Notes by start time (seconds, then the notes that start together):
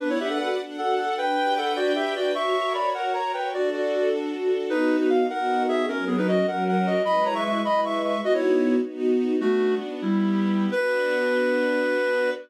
0.00 B3 D4 B4 D5 F#5
0.09 E4 C#5
0.19 D4 G4 E5
0.29 A4 F#5
0.39 F#4 A4 F#5
0.59 D4 A4 F#5
0.78 F#4 A4 F#5
0.98 A4 F#5
1.18 D4 B4 G5
1.37 G4
1.56 A4 B4 F#5
1.76 D4 F#4 D5
1.95 G4 E5
2.16 F#4 B4 D5
2.35 F#4 A#4 C#5 E5 C#6
2.55 A#4
2.74 C#5 D5 B5
2.94 F#4 A#4 F#5
3.13 A#4 C#5 A#5
3.33 B4 C#5 G5
3.53 D4 F#4 A4 D5
3.72 F#4 D5
3.93 A4
4.12 D4
4.31 F#4
4.51 A4
4.70 B3 D#4 F#4 B4
5.01 D#4 B4
5.10 F5
5.29 B3 D#4 F#4 A#4 F#5
5.68 G#4 E5
5.88 F#3 C#4 A#4
6.07 B3 G#4
6.18 D#4 B4
6.28 F#4 D#5
6.47 F#3 C#4 A#4 F#5
6.68 A#4 F#5
6.86 F#4 D#5
7.05 G#3 E4 B4 D#5 B5
7.25 C#5 A#5
7.35 E5 C#6
7.45 E5 C#6
7.64 G#3 E4 B4 D#5 B5
7.85 E5 C#6
8.04 E5 C#6
8.24 B3 D#4 F#4 D#5
8.34 E4 C#5
8.82 B3 D#4 F#4
9.41 A3 B3 D4 F#4
10.02 G3 B3 E4 G4
10.71 B3 D4 F#4 B4